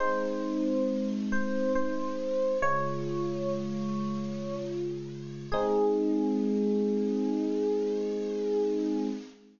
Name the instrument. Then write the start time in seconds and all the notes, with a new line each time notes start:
electric piano 1
0.00 G#3 C4 D#4 C5
1.32 C5
1.75 C5
2.62 C#3 G#3 F4 C#5
5.52 G#3 C4 D#4 G#4